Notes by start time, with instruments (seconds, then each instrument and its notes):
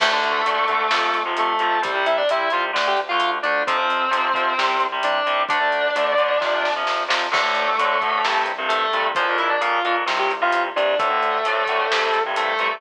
0.00 synth bass 1 D2, overdriven guitar D3 A3, distortion guitar A3 A4, kick, crash
0.13 overdriven guitar D3 A3
0.23 synth bass 1 D2, closed hi-hat
0.46 synth bass 1 D2, overdriven guitar D3 A3, closed hi-hat
0.68 synth bass 1 D2, overdriven guitar D3 A3, kick, closed hi-hat
0.91 synth bass 1 F2, overdriven guitar C3 F3, snare
1.14 synth bass 1 F2, closed hi-hat
1.26 overdriven guitar C3 F3
1.37 synth bass 1 F2, distortion guitar A3 A4, closed hi-hat
1.59 synth bass 1 F2, overdriven guitar C3 F3, closed hi-hat
1.82 synth bass 1 C2, overdriven guitar C3 G3, distortion guitar G3 G4, kick, closed hi-hat
1.95 overdriven guitar C3 G3
2.06 synth bass 1 C2, distortion guitar E4 E5, closed hi-hat
2.17 distortion guitar D4 D5
2.29 synth bass 1 C2, overdriven guitar C3 G3, distortion guitar E4 E5, closed hi-hat
2.50 synth bass 1 C2, overdriven guitar C3 G3, distortion guitar F4 F5, closed hi-hat
2.73 synth bass 1 D2, overdriven guitar D3 A3, snare
2.87 distortion guitar G4 G5
2.97 synth bass 1 D2, closed hi-hat
3.09 overdriven guitar D3 A3, distortion guitar F4 F5
3.20 synth bass 1 D2, closed hi-hat
3.43 synth bass 1 D2, overdriven guitar D3 A3, distortion guitar D4 D5, closed hi-hat
3.67 synth bass 1 F2, overdriven guitar C3 F3, distortion guitar C4 C5, kick, closed hi-hat
3.77 overdriven guitar C3 F3
3.90 synth bass 1 F2, closed hi-hat
4.11 synth bass 1 F2, overdriven guitar C3 F3, closed hi-hat
4.34 synth bass 1 F2, overdriven guitar C3 F3, kick, closed hi-hat
4.58 synth bass 1 C2, overdriven guitar C3 G3, kick, snare
4.80 synth bass 1 C2, closed hi-hat
4.92 overdriven guitar C3 G3
5.03 synth bass 1 C2, distortion guitar D4 D5, closed hi-hat
5.26 synth bass 1 C2, overdriven guitar C3 G3, closed hi-hat
5.49 synth bass 1 D2, overdriven guitar D3 A3, distortion guitar D4 D5, kick, closed hi-hat
5.60 overdriven guitar D3 A3
5.72 synth bass 1 D2, closed hi-hat
5.95 synth bass 1 D2, overdriven guitar D3 A3, closed hi-hat
6.18 synth bass 1 D2, overdriven guitar D3 A3, closed hi-hat
6.41 synth bass 1 F2, overdriven guitar C3 F3, kick, snare
6.64 synth bass 1 F2, snare
6.76 overdriven guitar C3 F3
6.87 synth bass 1 F2, snare
7.08 synth bass 1 F2, overdriven guitar C3 F3, snare
7.31 synth bass 1 D2, overdriven guitar A2 D3, distortion guitar A3 A4, kick, crash
7.43 overdriven guitar A2 D3
7.55 synth bass 1 D2, closed hi-hat
7.79 synth bass 1 D2, overdriven guitar A2 D3, closed hi-hat
8.02 synth bass 1 D2, overdriven guitar A2 D3, kick, closed hi-hat
8.24 synth bass 1 C2, overdriven guitar G2 C3, snare
8.46 synth bass 1 C2, closed hi-hat
8.58 overdriven guitar G2 C3
8.69 synth bass 1 C2, distortion guitar A3 A4, closed hi-hat
8.93 synth bass 1 C2, overdriven guitar G2 C3, closed hi-hat
9.15 synth bass 1 A#1, overdriven guitar F2 A#2, distortion guitar F3 F4, kick, closed hi-hat
9.29 overdriven guitar F2 A#2
9.38 synth bass 1 A#1, distortion guitar E4 E5, closed hi-hat
9.49 distortion guitar D4 D5
9.61 synth bass 1 A#1, overdriven guitar F2 A#2, distortion guitar F4 F5, closed hi-hat
9.84 synth bass 1 A#1, overdriven guitar F2 A#2, distortion guitar F4 F5, closed hi-hat
10.06 synth bass 1 C2, overdriven guitar G2 C3, snare
10.19 distortion guitar G4 G5
10.31 synth bass 1 C2, closed hi-hat
10.42 overdriven guitar G2 C3, distortion guitar F4 F5
10.52 synth bass 1 C2, closed hi-hat
10.76 synth bass 1 C2, overdriven guitar G2 C3, distortion guitar D4 D5, closed hi-hat
10.99 synth bass 1 D2, overdriven guitar A2 D3, distortion guitar A3 A4, kick, closed hi-hat
11.10 overdriven guitar A2 D3
11.22 synth bass 1 D2, closed hi-hat
11.45 synth bass 1 D2, overdriven guitar A2 D3, closed hi-hat
11.66 synth bass 1 D2, overdriven guitar A2 D3, kick, closed hi-hat
11.91 synth bass 1 C2, overdriven guitar G2 C3, snare
12.14 synth bass 1 C2, closed hi-hat
12.26 overdriven guitar G2 C3
12.36 synth bass 1 C2, distortion guitar A3 A4, closed hi-hat
12.59 synth bass 1 C2, overdriven guitar G2 C3, closed hi-hat